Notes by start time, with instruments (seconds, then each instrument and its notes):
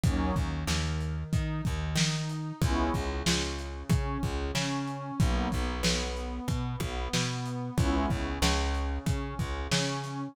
0.03 electric bass (finger) D#2, pad 2 (warm) F#3 A#3 C#4 D#4, kick, closed hi-hat
0.36 electric bass (finger) D#2, pad 2 (warm) D#3, kick, closed hi-hat
0.67 electric bass (finger) D#2, pad 2 (warm) D#3, snare
1.01 closed hi-hat
1.33 electric bass (finger) D#3, pad 2 (warm) D#4, kick, closed hi-hat
1.65 electric bass (finger) D#2, pad 2 (warm) D#3, kick, closed hi-hat
1.96 electric bass (finger) D#3, pad 2 (warm) D#4, snare
2.30 closed hi-hat
2.61 electric bass (finger) C#2, pad 2 (warm) G#3 B3 C#4 E4, kick, closed hi-hat
2.94 electric bass (finger) C#2, pad 2 (warm) C#3, kick, closed hi-hat
3.26 electric bass (finger) C#2, pad 2 (warm) C#3, snare
3.59 closed hi-hat
3.90 electric bass (finger) C#3, pad 2 (warm) C#4, kick, closed hi-hat
4.23 electric bass (finger) C#2, pad 2 (warm) C#3, kick, closed hi-hat
4.55 electric bass (finger) C#3, pad 2 (warm) C#4, snare
4.88 closed hi-hat
5.19 electric bass (finger) B1, pad 2 (warm) F#3 A#3 B3 D#4, kick, closed hi-hat
5.52 electric bass (finger) B1, pad 2 (warm) B3, kick, closed hi-hat
5.83 electric bass (finger) B1, pad 2 (warm) B3, snare
6.17 closed hi-hat
6.48 electric bass (finger) B2, pad 2 (warm) B3, kick, closed hi-hat
6.80 electric bass (finger) B1, pad 2 (warm) B3, kick, closed hi-hat
7.13 electric bass (finger) B2, pad 2 (warm) B3, snare
7.46 closed hi-hat
7.78 electric bass (finger) C#2, pad 2 (warm) G#3 B3 C#4 E4, kick, closed hi-hat
8.10 electric bass (finger) C#2, pad 2 (warm) C#3, kick
8.42 electric bass (finger) C#2, pad 2 (warm) C#3, snare
8.75 closed hi-hat
9.06 electric bass (finger) C#3, pad 2 (warm) C#4, kick, closed hi-hat
9.39 electric bass (finger) C#2, pad 2 (warm) C#3, kick, closed hi-hat
9.72 electric bass (finger) C#3, pad 2 (warm) C#4, snare
10.04 snare, closed hi-hat